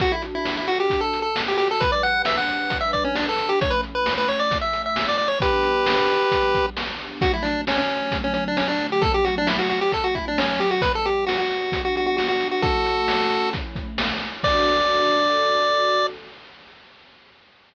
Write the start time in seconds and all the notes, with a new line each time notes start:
0.00 D4 F#4 A4, kick, closed hi-hat
0.12 E4
0.22 closed hi-hat
0.35 E4
0.45 snare
0.57 E4
0.67 F#4, closed hi-hat
0.80 G4
0.90 kick, closed hi-hat
1.01 A4
1.13 closed hi-hat
1.22 A4
1.36 snare
1.48 G4
1.58 G4, closed hi-hat
1.71 A4
1.80 G3 D4 B4, kick, closed hi-hat
1.92 D5
2.03 F#5, closed hi-hat
2.25 E5, snare
2.37 F#5
2.48 closed hi-hat
2.70 kick, closed hi-hat
2.81 E5
2.93 D5, kick, closed hi-hat
3.04 C#4
3.15 D4, snare
3.29 A4
3.38 closed hi-hat
3.49 G4
3.61 A3 C#4 E4 C#5, kick, closed hi-hat
3.70 B4
3.83 closed hi-hat
3.95 B4
4.06 snare
4.18 B4
4.28 C#5, closed hi-hat
4.39 D5
4.51 kick, closed hi-hat
4.61 E5
4.73 closed hi-hat
4.86 E5
4.96 snare
5.08 D5
5.18 D5, closed hi-hat
5.28 C#5
5.40 G3 B3 D4 G4 B4, kick, closed hi-hat
5.63 closed hi-hat
5.86 snare
6.09 closed hi-hat
6.32 kick, closed hi-hat
6.55 kick, closed hi-hat
6.77 snare
6.99 closed hi-hat
7.21 D3 F#3 A3 F#4, kick, closed hi-hat
7.33 E4
7.42 D4, closed hi-hat
7.67 C#4, snare
7.78 C#4
7.89 closed hi-hat
8.12 kick, closed hi-hat
8.24 C#4
8.34 C#4, closed hi-hat
8.48 D4
8.57 C#4, snare
8.68 D4
8.79 closed hi-hat
8.92 G4
9.02 F#3 A3 C#4 A4, kick, closed hi-hat
9.14 G4
9.25 F#4, closed hi-hat
9.38 D4
9.47 E4, snare
9.59 F#4
9.69 F#4, closed hi-hat
9.81 G4
9.92 A4, kick, closed hi-hat
10.04 F#4
10.15 E4, kick, closed hi-hat
10.28 D4
10.38 C#4, snare
10.60 G4, closed hi-hat
10.71 F#4
10.82 G3 B3 D4 B4, kick, closed hi-hat
10.95 A4
11.05 G4, closed hi-hat
11.27 F#4, snare
11.38 F#4
11.51 closed hi-hat
11.72 kick, closed hi-hat
11.85 F#4
11.96 F#4, closed hi-hat
12.06 F#4
12.17 F#4, snare
12.28 F#4
12.41 closed hi-hat
12.51 F#4
12.62 A3 C#4 E4 F#4 A4, kick, closed hi-hat
12.85 closed hi-hat
13.08 snare
13.30 closed hi-hat
13.53 kick, closed hi-hat
13.76 kick, closed hi-hat
13.98 snare
14.22 closed hi-hat
14.43 D4 F#4 A4 D5, kick, crash